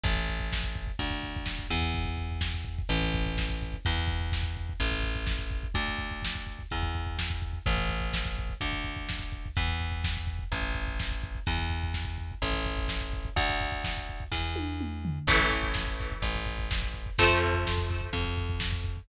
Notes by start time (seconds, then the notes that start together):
0.03 A1, kick, crash
0.16 kick
0.29 kick, closed hi-hat
0.40 kick
0.52 kick, snare
0.63 kick
0.75 kick, closed hi-hat
0.87 kick
0.99 D2, kick, closed hi-hat
1.11 kick
1.23 kick, closed hi-hat
1.36 kick
1.46 kick, snare
1.59 kick
1.70 E2, kick, closed hi-hat
1.82 kick
1.94 kick, closed hi-hat
2.05 kick
2.17 kick, closed hi-hat
2.31 kick
2.41 kick, snare
2.54 kick
2.65 kick, closed hi-hat
2.78 kick
2.89 A1, kick, closed hi-hat
3.02 kick
3.13 kick, closed hi-hat
3.26 kick
3.38 kick, snare
3.49 kick
3.61 kick, open hi-hat
3.74 kick
3.85 E2, kick, closed hi-hat
3.98 kick
4.08 kick, closed hi-hat
4.20 kick
4.32 kick, snare
4.43 kick
4.56 kick, closed hi-hat
4.69 kick
4.80 A1, kick, closed hi-hat
4.92 kick
5.03 kick, closed hi-hat
5.15 kick
5.26 kick, snare
5.39 kick
5.51 kick, closed hi-hat
5.63 kick
5.74 D2, kick, closed hi-hat
5.88 kick
5.98 kick, closed hi-hat
6.11 kick
6.22 kick, snare
6.35 kick
6.47 kick, closed hi-hat
6.59 kick
6.70 E2, kick, closed hi-hat
6.83 kick
6.93 kick, closed hi-hat
7.07 kick
7.18 kick, snare
7.30 kick
7.42 kick, closed hi-hat
7.53 kick
7.66 A1, kick, closed hi-hat
7.78 kick
7.89 kick, closed hi-hat
8.00 kick
8.13 kick, snare
8.25 kick
8.36 kick, closed hi-hat
8.49 kick
8.61 D2, kick, closed hi-hat
8.73 kick
8.84 kick, closed hi-hat
8.96 kick
9.09 kick, snare
9.19 kick
9.32 kick, closed hi-hat
9.46 kick
9.56 E2, kick, closed hi-hat
9.68 kick
9.80 kick, closed hi-hat
9.92 kick
10.04 kick, snare
10.17 kick
10.27 kick, closed hi-hat
10.39 kick
10.52 A1, kick, closed hi-hat
10.62 kick
10.74 kick, closed hi-hat
10.87 kick
10.99 kick, snare
11.11 kick
11.24 kick, closed hi-hat
11.35 kick
11.46 E2, kick, closed hi-hat
11.59 kick
11.70 kick, closed hi-hat
11.83 kick
11.94 kick, snare
12.05 kick
12.18 kick, closed hi-hat
12.32 kick
12.42 A1, kick, closed hi-hat
12.53 kick
12.66 kick, closed hi-hat
12.78 kick
12.88 kick, snare
13.01 kick
13.13 kick, closed hi-hat
13.25 kick
13.36 D2, kick, closed hi-hat
13.50 kick
13.61 kick, closed hi-hat
13.72 kick
13.84 kick, snare
13.97 kick
14.08 kick, closed hi-hat
14.20 kick
14.32 E2, kick, snare
14.56 high tom
14.81 mid tom
15.05 floor tom
15.27 A1 E3 A3, kick, crash
15.39 kick
15.51 kick, closed hi-hat
15.63 kick
15.74 kick, snare
15.87 kick
15.99 kick, closed hi-hat
16.12 kick
16.22 A1, kick, closed hi-hat
16.36 kick
16.46 kick, closed hi-hat
16.59 kick
16.71 kick, snare
16.82 kick
16.94 kick, closed hi-hat
17.06 kick
17.18 F2 F3 A3 C4, kick, closed hi-hat
17.30 kick
17.41 kick, closed hi-hat
17.54 kick
17.65 kick, snare
17.78 kick
17.88 kick, closed hi-hat
18.01 kick
18.13 F2, kick, closed hi-hat
18.25 kick
18.37 kick, closed hi-hat
18.50 kick
18.60 kick, snare
18.72 kick
18.84 kick, closed hi-hat
18.97 kick